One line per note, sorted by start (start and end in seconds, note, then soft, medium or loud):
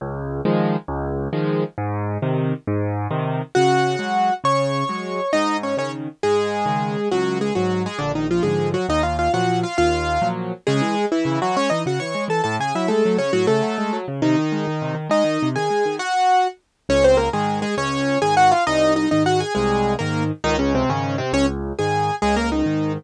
0.01 0.41 C#2 loud
0.45 0.76 D#3 medium
0.45 0.76 F3 medium
0.45 0.76 G#3 medium
0.88 1.28 C#2 loud
1.33 1.64 D#3 medium
1.33 1.64 F3 medium
1.33 1.64 G#3 medium
1.78 2.18 G#2 medium
2.22 2.53 C3 medium
2.22 2.53 D#3 medium
2.67 3.07 G#2 medium
3.11 3.42 C3 medium
3.11 3.42 D#3 medium
3.55 3.96 C#3 medium
3.55 4.34 F#4 loud
3.55 4.34 F#5 loud
3.99 4.30 F#3 medium
3.99 4.30 G#3 medium
4.44 4.84 C#3 medium
4.44 5.31 C#5 medium
4.44 5.31 C#6 loud
4.89 5.20 F#3 medium
4.89 5.20 G#3 medium
5.33 5.74 G#2 medium
5.33 5.57 D#4 loud
5.33 5.57 D#5 loud
5.63 5.76 C#4 medium
5.63 5.76 C#5 medium
5.77 6.08 C#3 medium
5.77 6.08 D#3 medium
5.77 5.91 C#4 medium
5.77 5.91 C#5 loud
6.23 6.64 G#2 medium
6.23 7.09 G#3 loud
6.23 7.09 G#4 loud
6.66 6.97 C#3 medium
6.66 6.97 D#3 medium
7.11 7.51 C#2 medium
7.11 7.38 F#3 loud
7.11 7.38 F#4 loud
7.41 7.54 G#3 medium
7.41 7.54 G#4 loud
7.55 7.87 G#2 medium
7.55 7.82 F#3 medium
7.55 7.87 F#3 medium
7.55 7.82 F#4 loud
7.86 7.99 G#3 medium
7.86 7.99 G#4 loud
7.99 8.40 A#1 medium
7.99 8.12 D3 medium
7.99 8.12 D4 loud
8.15 8.27 D#3 medium
8.15 8.27 D#4 medium
8.31 8.43 F3 medium
8.31 8.43 F4 loud
8.43 8.76 G#2 medium
8.43 8.76 D3 medium
8.43 8.76 F3 medium
8.43 8.69 G#3 medium
8.43 8.69 G#4 medium
8.74 8.86 F#3 medium
8.74 8.86 F#4 loud
8.89 9.29 D#2 medium
8.89 9.02 D#4 loud
8.89 9.02 D#5 loud
9.03 9.17 F4 medium
9.03 9.17 F5 medium
9.19 9.32 F4 medium
9.19 9.32 F5 medium
9.33 9.64 A#2 medium
9.33 9.64 F3 medium
9.33 9.64 F#3 medium
9.33 9.60 F#4 medium
9.33 9.60 F#5 loud
9.63 9.77 F4 medium
9.63 9.77 F5 loud
9.78 10.18 D#2 medium
9.78 10.28 F4 loud
9.78 10.28 F5 loud
10.22 10.53 A#2 medium
10.22 10.53 F3 medium
10.22 10.53 F#3 medium
10.67 10.81 C#3 medium
10.67 11.05 G#3 loud
10.67 11.05 G#4 loud
10.81 10.95 E3 medium
10.95 11.08 G#3 medium
11.12 11.40 E3 medium
11.12 11.40 E4 loud
11.25 11.39 C#3 medium
11.42 11.55 E3 medium
11.42 11.56 F#3 loud
11.42 11.56 F#4 loud
11.56 11.70 G#3 medium
11.56 11.69 C#4 loud
11.56 11.69 C#5 loud
11.70 11.85 E3 medium
11.70 11.82 D#4 medium
11.70 11.82 D#5 loud
11.86 11.99 C#3 medium
11.86 11.99 F#4 medium
11.86 11.99 F#5 medium
12.00 12.14 E3 medium
12.00 12.24 C#5 medium
12.00 12.24 C#6 medium
12.15 12.28 G#3 medium
12.28 12.41 E3 medium
12.28 12.42 A4 medium
12.28 12.42 A5 medium
12.44 12.58 A2 medium
12.44 12.56 A4 medium
12.44 12.56 A5 loud
12.59 12.73 C#3 medium
12.59 12.74 G#4 medium
12.59 12.74 G#5 medium
12.75 12.88 F#3 medium
12.75 12.89 E4 medium
12.75 12.89 E5 medium
12.88 13.03 G#3 medium
12.88 13.17 A3 medium
12.88 13.17 A4 loud
13.05 13.19 F#3 medium
13.17 13.31 C#3 medium
13.17 13.32 C#4 medium
13.17 13.32 C#5 loud
13.33 13.47 A2 medium
13.33 13.46 F#3 loud
13.33 13.46 F#4 loud
13.47 13.62 C#3 medium
13.47 13.97 A3 medium
13.47 13.97 A4 loud
13.63 13.76 F#3 medium
13.78 13.91 G#3 medium
13.93 14.06 F#3 medium
14.08 14.21 C#3 medium
14.22 14.36 C3 medium
14.22 14.95 D#3 loud
14.22 14.95 D#4 loud
14.38 14.52 D#3 medium
14.52 14.66 G#3 medium
14.68 14.81 D#3 medium
14.82 14.95 C3 medium
14.95 15.08 D#3 medium
15.09 15.23 G#3 medium
15.09 15.48 D#4 loud
15.09 15.48 D#5 loud
15.24 15.38 D#3 medium
15.43 15.56 C3 medium
15.56 15.69 D#3 medium
15.56 15.96 G#4 medium
15.56 15.96 G#5 medium
15.70 15.84 G#3 medium
15.86 15.99 D#3 medium
15.99 16.48 F#4 loud
15.99 16.48 F#5 loud
16.89 17.29 C#2 medium
16.89 17.04 C#4 loud
16.89 17.04 C#5 loud
17.04 17.17 C4 loud
17.04 17.17 C5 loud
17.17 17.29 A#3 medium
17.17 17.29 A#4 loud
17.33 17.64 G#2 medium
17.33 17.64 D#3 medium
17.33 17.59 G#3 medium
17.33 17.59 G#4 loud
17.62 17.75 G#3 loud
17.62 17.75 G#4 loud
17.77 18.17 C#2 medium
17.77 18.19 C#4 loud
17.77 18.19 C#5 loud
18.22 18.53 G#2 medium
18.22 18.53 D#3 medium
18.22 18.35 G#4 loud
18.22 18.35 G#5 loud
18.37 18.51 F#4 loud
18.37 18.51 F#5 loud
18.52 18.64 F4 medium
18.52 18.64 F5 loud
18.67 19.07 C2 medium
18.67 18.93 D#4 loud
18.67 18.93 D#5 loud
18.96 19.09 D#4 medium
18.96 19.09 D#5 loud
19.11 19.43 G#2 medium
19.11 19.43 D#3 medium
19.11 19.23 D#4 medium
19.11 19.23 D#5 loud
19.26 19.40 F#4 loud
19.26 19.40 F#5 loud
19.40 19.53 G#4 medium
19.40 19.53 G#5 loud
19.55 19.96 C2 medium
19.55 19.94 G#3 loud
19.55 19.94 G#4 loud
19.99 20.32 G#2 medium
19.99 20.32 D#3 medium
19.99 20.23 A#3 medium
19.99 20.23 A#4 loud
20.44 20.84 C#2 medium
20.44 20.56 D#3 loud
20.44 20.56 D#4 loud
20.59 20.73 C#3 loud
20.59 20.73 C#4 loud
20.75 20.89 C3 loud
20.75 20.89 C4 loud
20.89 21.20 G#2 medium
20.89 21.16 C#3 medium
20.89 21.20 D#3 medium
20.89 21.16 C#4 loud
21.18 21.32 C3 loud
21.18 21.32 C4 loud
21.33 21.73 C#2 medium
21.33 21.46 C#4 loud
21.33 21.46 C#5 loud
21.79 22.11 G#2 medium
21.79 22.11 D#3 medium
21.79 22.15 G#4 medium
21.79 22.15 G#5 medium
22.22 22.63 C#2 medium
22.22 22.35 G#3 loud
22.22 22.35 G#4 loud
22.36 22.50 A#3 loud
22.36 22.50 A#4 loud
22.52 22.93 D#3 medium
22.52 22.93 D#4 medium
22.66 22.97 G#2 medium
22.66 22.97 D#3 medium